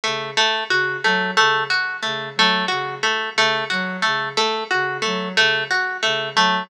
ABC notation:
X:1
M:5/8
L:1/8
Q:1/4=90
K:none
V:1 name="Ocarina" clef=bass
_D, z D, _G, D, | z _D, _G, D, z | _D, _G, D, z D, | _G, _D, z D, G, |]
V:2 name="Pizzicato Strings"
A, A, _G A, A, | _G A, A, G A, | A, _G A, A, G | A, A, _G A, A, |]